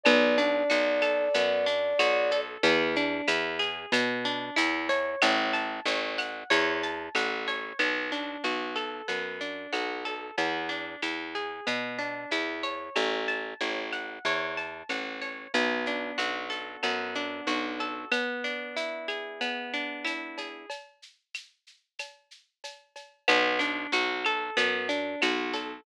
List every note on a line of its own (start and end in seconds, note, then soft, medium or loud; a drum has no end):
0.04 0.64 B1 loud
0.04 0.39 B3 loud
0.04 2.40 D5 medium
0.04 cowbell loud
0.04 claves loud
0.04 shaker loud
0.38 0.70 D4 medium
0.38 shaker medium
0.70 1.29 B1 medium
0.70 1.02 F#4 loud
0.70 shaker loud
1.02 1.34 A4 loud
1.02 claves medium
1.02 shaker medium
1.34 1.94 F#2 medium
1.34 1.67 B3 loud
1.34 cowbell medium
1.34 shaker loud
1.66 1.99 D4 medium
1.66 shaker medium
1.99 2.58 B1 medium
1.99 2.32 F#4 loud
1.99 cowbell medium
1.99 claves loud
1.99 shaker loud
2.31 2.63 A4 medium
2.31 cowbell medium
2.31 shaker medium
2.63 3.22 E2 loud
2.63 2.96 B3 loud
2.63 cowbell loud
2.63 shaker loud
2.96 3.29 D4 medium
2.96 shaker medium
3.28 3.86 E2 medium
3.28 3.60 E4 medium
3.28 claves medium
3.28 shaker loud
3.59 3.92 G#4 medium
3.59 shaker medium
3.92 4.50 B2 loud
3.92 4.26 B3 medium
3.92 cowbell medium
3.92 claves medium
3.92 shaker loud
4.25 4.57 D4 loud
4.25 shaker medium
4.56 5.16 E2 medium
4.56 4.89 E4 loud
4.56 cowbell medium
4.56 shaker loud
4.89 5.54 C#5 loud
4.89 cowbell medium
4.89 shaker medium
5.22 5.80 A1 loud
5.22 cowbell loud
5.22 claves loud
5.22 shaker loud
5.53 5.86 A5 medium
5.53 shaker medium
5.85 6.44 A1 medium
5.85 6.19 C#5 medium
5.85 shaker loud
6.18 6.51 F#5 medium
6.18 claves medium
6.18 shaker medium
6.50 7.09 E2 loud
6.50 6.83 C#5 loud
6.50 cowbell medium
6.50 shaker loud
6.83 7.16 A5 medium
6.83 shaker medium
7.15 7.73 A1 medium
7.15 7.48 F#5 medium
7.15 cowbell medium
7.15 claves medium
7.15 shaker loud
7.47 7.78 C#5 medium
7.47 cowbell medium
7.47 shaker medium
7.79 8.37 B1 medium
7.79 8.11 B3 medium
7.79 cowbell medium
7.79 claves medium
7.79 shaker medium
8.12 8.44 D4 medium
8.12 shaker medium
8.44 9.02 B1 medium
8.44 8.77 F#4 medium
8.44 shaker medium
8.76 9.08 A4 medium
8.76 claves medium
8.76 shaker medium
9.08 9.67 F#2 medium
9.08 9.40 B3 medium
9.08 cowbell medium
9.08 shaker medium
9.41 9.73 D4 medium
9.41 shaker medium
9.73 10.31 B1 medium
9.73 10.05 F#4 medium
9.73 cowbell medium
9.73 claves medium
9.73 shaker medium
10.05 10.36 A4 medium
10.05 cowbell medium
10.05 shaker medium
10.38 10.96 E2 medium
10.38 10.70 B3 medium
10.38 cowbell medium
10.38 shaker medium
10.69 11.01 D4 medium
10.69 shaker medium
11.02 11.60 E2 medium
11.02 11.35 E4 medium
11.02 claves medium
11.02 shaker medium
11.35 11.67 G#4 medium
11.35 shaker medium
11.67 12.26 B2 medium
11.67 11.99 B3 medium
11.67 cowbell medium
11.67 claves medium
11.67 shaker medium
11.99 12.31 D4 medium
11.99 shaker medium
12.31 12.90 E2 medium
12.31 12.64 E4 medium
12.31 cowbell medium
12.31 shaker medium
12.63 13.28 C#5 medium
12.63 cowbell medium
12.63 shaker medium
12.96 13.54 A1 medium
12.96 cowbell medium
12.96 claves medium
12.96 shaker medium
13.28 13.60 A5 medium
13.28 shaker medium
13.61 14.19 A1 medium
13.61 13.93 C#5 medium
13.61 shaker medium
13.92 14.25 F#5 medium
13.92 claves medium
13.92 shaker medium
14.25 14.83 E2 medium
14.25 14.58 C#5 medium
14.25 cowbell medium
14.25 shaker medium
14.57 14.90 A5 medium
14.57 shaker medium
14.89 15.47 A1 medium
14.89 15.22 F#5 medium
14.89 cowbell medium
14.89 claves medium
14.89 shaker medium
15.22 15.52 C#5 medium
15.22 cowbell medium
15.22 shaker medium
15.54 16.12 B1 medium
15.54 16.83 B3 loud
15.54 cowbell medium
15.54 shaker loud
15.86 17.15 D4 medium
15.86 shaker medium
16.18 16.77 B1 medium
16.18 17.47 F#4 medium
16.18 claves medium
16.18 shaker loud
16.50 17.80 A4 medium
16.50 shaker medium
16.83 17.41 F#2 medium
16.83 18.06 B3 medium
16.83 cowbell medium
16.83 claves medium
16.83 shaker medium
17.15 18.08 D4 medium
17.15 shaker medium
17.47 18.05 B1 medium
17.47 18.09 F#4 medium
17.47 cowbell medium
17.47 shaker medium
17.80 18.11 A4 medium
17.80 cowbell medium
17.80 shaker medium
18.12 19.40 B3 medium
18.12 cowbell medium
18.12 claves loud
18.12 shaker loud
18.44 19.73 D4 medium
18.44 shaker medium
18.77 20.04 E4 medium
18.77 shaker loud
19.08 20.38 G#4 medium
19.08 claves medium
19.08 shaker medium
19.41 20.64 B3 medium
19.41 cowbell medium
19.41 shaker medium
19.74 20.66 D4 medium
19.74 shaker medium
20.05 20.66 E4 medium
20.05 cowbell medium
20.05 claves medium
20.05 shaker medium
20.38 20.69 G#4 medium
20.38 cowbell medium
20.38 shaker medium
20.70 cowbell medium
20.70 shaker medium
21.02 shaker medium
21.34 claves medium
21.34 shaker loud
21.67 shaker medium
21.99 cowbell medium
21.99 claves medium
21.99 shaker loud
22.31 shaker medium
22.64 cowbell medium
22.64 shaker loud
22.96 cowbell medium
22.96 shaker medium
23.28 23.87 B1 loud
23.28 23.60 B3 loud
23.28 cowbell loud
23.28 claves loud
23.28 shaker loud
23.59 23.92 D4 medium
23.59 shaker medium
23.92 24.50 B1 medium
23.92 24.26 F#4 loud
23.92 shaker loud
24.25 24.58 A4 loud
24.25 claves medium
24.25 shaker medium
24.57 25.16 F#2 medium
24.57 24.89 B3 loud
24.57 cowbell medium
24.57 shaker loud
24.89 25.21 D4 medium
24.89 shaker medium
25.22 25.81 B1 medium
25.22 25.55 F#4 loud
25.22 cowbell medium
25.22 claves loud
25.22 shaker loud
25.54 25.84 A4 medium
25.54 cowbell medium
25.54 shaker medium